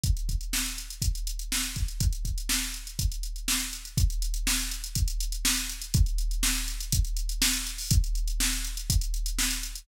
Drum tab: HH |xxxx-xxxxxxx-xxx|xxxx--xxxxxx-xxx|xxxx-xxxxxxx-xxx|xxxx-xxxxxxx-xxo|
SD |----o-------o---|----o-------o---|----o-------o---|----o-------o---|
BD |o-o-----o-----o-|o-o-----o-------|o-------o-------|o-------o-------|

HH |xxxx-xxxxxxx-xxx|
SD |----o-------o---|
BD |o-------o-------|